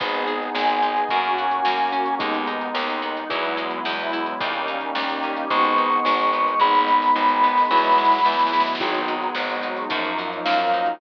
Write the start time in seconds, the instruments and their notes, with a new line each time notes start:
0.00 electric bass (finger) G#1, pad 2 (warm) B3 D#4 G#4, acoustic guitar (steel) B3, acoustic grand piano B3 D#4 G#4, kick, crash
0.13 closed hi-hat
0.27 acoustic guitar (steel) G#4, closed hi-hat
0.42 closed hi-hat
0.55 electric bass (finger) G#1, pad 2 (warm) G#3 B3 G#4, acoustic guitar (steel) B3, lead 1 (square) G#5, snare
0.69 closed hi-hat
0.82 acoustic guitar (steel) D#4, closed hi-hat
0.97 closed hi-hat
1.09 electric bass (finger) F#2, pad 2 (warm) A#3 C#4 F#4, acoustic grand piano A#3 C#4 F#4, acoustic guitar (steel) A#3, kick, closed hi-hat
1.25 closed hi-hat
1.38 acoustic guitar (steel) F#4, closed hi-hat
1.51 closed hi-hat
1.65 electric bass (finger) F#2, pad 2 (warm) F#3 A#3 F#4, acoustic guitar (steel) A#3, snare
1.79 closed hi-hat
1.92 acoustic guitar (steel) C#4, closed hi-hat
2.06 closed hi-hat
2.19 electric bass (finger) D#2, acoustic grand piano G#3 B3 D#4, pad 2 (warm) G#3 B3 D#4, acoustic guitar (steel) G#3, kick, closed hi-hat
2.34 closed hi-hat
2.47 acoustic guitar (steel) D#4, closed hi-hat
2.61 closed hi-hat
2.75 electric bass (finger) D#2, pad 2 (warm) D#3 G#3 D#4, acoustic guitar (steel) G#3, snare
2.90 closed hi-hat
3.02 acoustic guitar (steel) B3, closed hi-hat
3.17 closed hi-hat
3.29 electric bass (finger) E2, acoustic grand piano F#3 G#3 B3 E4, pad 2 (warm) F#3 G#3 B3 E4, acoustic guitar (steel) F#3, kick, closed hi-hat
3.45 closed hi-hat
3.57 acoustic guitar (steel) G#3, closed hi-hat
3.70 closed hi-hat
3.85 electric bass (finger) E2, pad 2 (warm) E3 F#3 G#3 E4, acoustic guitar (steel) B3, snare
3.99 closed hi-hat
4.13 acoustic guitar (steel) E4, closed hi-hat
4.26 closed hi-hat
4.40 electric bass (finger) D#2, acoustic grand piano G3 A#3 C#4 D#4, pad 2 (warm) G3 A#3 C#4 D#4, acoustic guitar (steel) G3, kick, closed hi-hat
4.53 closed hi-hat
4.68 acoustic guitar (steel) D#4, closed hi-hat
4.81 closed hi-hat
4.95 electric bass (finger) D#2, pad 2 (warm) G3 A#3 D#4 G4, acoustic guitar (steel) G3, snare
5.09 closed hi-hat
5.23 acoustic guitar (steel) C#4, closed hi-hat
5.36 closed hi-hat
5.50 electric bass (finger) G#1, pad 2 (warm) G#3 B3 D#4, acoustic grand piano G#3 B3 D#4, acoustic guitar (steel) G#3, lead 1 (square) C#6, kick, closed hi-hat
5.64 closed hi-hat
5.78 acoustic guitar (steel) D#4, closed hi-hat
5.92 closed hi-hat
6.05 electric bass (finger) G#1, pad 2 (warm) D#3 G#3 D#4, acoustic guitar (steel) G#3, snare
6.19 closed hi-hat
6.33 acoustic guitar (steel) B3, closed hi-hat
6.48 closed hi-hat
6.60 electric bass (finger) G#1, pad 2 (warm) G#3 B3 D#4, acoustic guitar (steel) G#3, acoustic grand piano G#3 B3 D#4, lead 1 (square) B5, kick, snare
6.75 snare
6.87 acoustic guitar (steel) D#4, snare
7.02 snare
7.15 electric bass (finger) G#1, pad 2 (warm) D#3 G#3 D#4, acoustic guitar (steel) G#3, snare
7.28 snare
7.43 acoustic guitar (steel) B3, snare
7.57 snare
7.70 electric bass (finger) E2, pad 2 (warm) F#3 G#3 B3 E4, acoustic guitar (steel) F#3, acoustic grand piano F#3 G#3 B3 E4, snare
7.77 snare
7.84 snare
7.92 snare
7.97 acoustic guitar (steel) G#3, snare
8.04 snare
8.12 snare
8.19 snare
8.25 electric bass (finger) E2, pad 2 (warm) E3 F#3 G#3 E4, acoustic guitar (steel) B3, snare
8.32 snare
8.39 snare
8.47 snare
8.53 acoustic guitar (steel) E4, snare
8.60 snare
8.67 snare
8.75 snare
8.80 electric bass (finger) G#1, pad 2 (warm) F#3 G#3 B3 D#4, acoustic grand piano F#3 G#3 B3 D#4, acoustic guitar (steel) F#3, kick, crash
8.94 closed hi-hat
9.08 acoustic guitar (steel) G#3, closed hi-hat
9.22 closed hi-hat
9.35 electric bass (finger) G#1, pad 2 (warm) F#3 G#3 D#4 F#4, acoustic guitar (steel) B3, snare
9.50 closed hi-hat
9.63 acoustic guitar (steel) D#4, closed hi-hat
9.77 closed hi-hat
9.89 electric bass (finger) F#2, acoustic grand piano F3 F#3 A#3 D#4, pad 2 (warm) F3 F#3 A#3 D#4, acoustic guitar (steel) F3, kick, closed hi-hat
10.05 closed hi-hat
10.18 acoustic guitar (steel) F#3, closed hi-hat
10.33 closed hi-hat
10.45 electric bass (finger) F#2, pad 2 (warm) D#3 F3 F#3 D#4, acoustic guitar (steel) A#3, lead 1 (square) F5, snare
10.59 closed hi-hat
10.74 acoustic guitar (steel) D#4, closed hi-hat
10.86 closed hi-hat